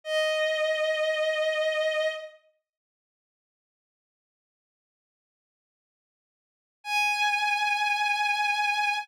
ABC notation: X:1
M:4/4
L:1/8
Q:1/4=106
K:G#m
V:1 name="Violin"
d8 | z8 | z8 | g8 |]